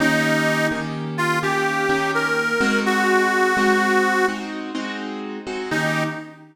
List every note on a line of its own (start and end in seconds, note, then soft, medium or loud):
0.00 0.68 D#3 loud
0.00 0.68 A#3 loud
0.00 0.68 C#4 loud
0.00 0.67 D#4 loud
0.00 0.68 G4 loud
0.71 1.39 D#3 medium
0.71 1.39 A#3 medium
0.71 1.39 C#4 medium
0.71 1.39 G4 medium
1.18 1.39 F4 loud
1.43 1.85 D#3 medium
1.43 1.85 A#3 medium
1.43 1.85 C#4 loud
1.43 2.11 G4 medium
1.43 1.85 G4 medium
1.89 2.53 D#3 loud
1.89 2.53 A#3 medium
1.89 2.53 C#4 loud
1.89 2.53 G4 loud
2.14 2.80 A#4 medium
2.61 3.53 G#3 loud
2.61 3.53 C4 loud
2.61 3.53 D#4 loud
2.61 3.53 F#4 loud
2.86 4.26 F#4 loud
3.57 4.24 G#3 medium
3.57 4.24 C4 medium
3.57 4.24 D#4 loud
3.57 4.24 F#4 loud
4.28 4.71 G#3 medium
4.28 4.71 C4 medium
4.28 4.71 D#4 medium
4.28 4.71 F#4 medium
4.75 5.39 G#3 loud
4.75 5.39 C4 medium
4.75 5.39 D#4 loud
4.75 5.39 F#4 medium
5.47 5.70 G#3 medium
5.47 5.70 C4 medium
5.47 5.70 D#4 medium
5.47 5.70 F#4 loud
5.71 6.04 D#3 loud
5.71 6.04 A#3 medium
5.71 6.04 C#4 loud
5.71 6.03 D#4 loud
5.71 6.04 G4 loud